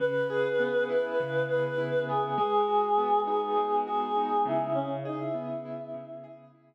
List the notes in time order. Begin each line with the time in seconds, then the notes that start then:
0.00 C#3 B4
0.30 G#4
0.59 B3
0.89 E4 B4
1.20 C#3
1.49 G#4 B4
1.78 E4
2.08 B3 G#4
2.37 G#3 G#4
2.68 F#4
2.97 B3
3.27 D#4 G#4
3.56 G#3
3.85 F#4 G#4
4.17 D#4
4.45 C#3 E4
4.75 C#4
5.05 D#4 G#4
5.20 E4
5.34 B3
5.65 E4
5.94 C#3
6.24 G#4
6.55 E4